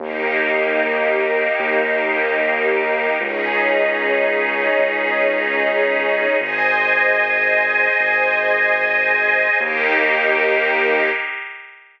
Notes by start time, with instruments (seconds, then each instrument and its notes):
0.00 synth bass 2 D#2, string ensemble 1 A#3 D#4 G4, pad 2 (warm) G4 A#4 D#5
1.59 synth bass 2 D#2
3.20 synth bass 2 C#2, string ensemble 1 C#4 D#4 G#4, pad 2 (warm) G#4 C#5 D#5
4.79 synth bass 2 C#2
6.40 synth bass 2 G#1, pad 2 (warm) G#4 C5 D#5, string ensemble 1 C5 D#5 G#5
8.00 synth bass 2 G#1
9.60 synth bass 2 D#2, string ensemble 1 A#3 D#4 G4, pad 2 (warm) G4 A#4 D#5